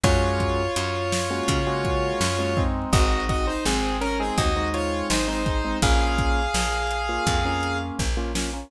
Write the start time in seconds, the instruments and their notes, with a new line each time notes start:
0.03 electric bass (finger) F#2, acoustic grand piano G#3 A#3 C#4 F#4, lead 1 (square) F4 C#5, kick, closed hi-hat
0.40 kick, closed hi-hat
0.76 electric bass (finger) F#2, closed hi-hat
1.12 snare
1.30 acoustic grand piano G#3 A#3 C#4 F#4
1.48 electric bass (finger) C#3, kick, closed hi-hat
1.67 acoustic grand piano G#3 A#3 C#4 F#4
1.85 kick, closed hi-hat
2.21 electric bass (finger) F#2, snare
2.39 acoustic grand piano G#3 A#3 C#4 F#4
2.57 acoustic grand piano G#3 C4 D#4, kick
2.93 electric bass (finger) G#1, lead 1 (square) F#4 D#5, kick, closed hi-hat
3.29 lead 1 (square) F#4 D#5, kick, closed hi-hat
3.47 lead 1 (square) D#4 C5
3.65 electric bass (finger) G#1, lead 1 (square) C4 G#4, snare
4.01 lead 1 (square) C#4 A#4, closed hi-hat
4.20 acoustic grand piano G#3 C4 D#4, lead 1 (square) C4 G#4
4.38 electric bass (finger) D#2, lead 1 (square) F#4 D#5, kick, closed hi-hat
4.56 acoustic grand piano G#3 C4 D#4
4.74 lead 1 (square) F4 C#5, closed hi-hat
5.10 electric bass (finger) G#1, lead 1 (square) D#4 C5, snare
5.28 acoustic grand piano G#3 C4 D#4, lead 1 (square) D#4 C5
5.46 acoustic grand piano G#3 C4 D#4, kick, closed hi-hat
5.64 acoustic grand piano G#3 C4 D#4
5.82 electric bass (finger) A#1, acoustic grand piano A#3 C#4 F4, lead 1 (square) G#4 F5, kick, closed hi-hat
6.18 kick, closed hi-hat
6.54 electric bass (finger) A#1, snare
6.91 closed hi-hat
7.09 acoustic grand piano A#3 C#4 F4
7.27 electric bass (finger) F2, kick, closed hi-hat
7.45 acoustic grand piano A#3 C#4 F4
7.63 closed hi-hat
7.99 electric bass (finger) A#1, kick, snare
8.17 acoustic grand piano A#3 C#4 F4
8.35 acoustic grand piano A#3 C#4 F4, snare
8.53 acoustic grand piano A#3 C#4 F4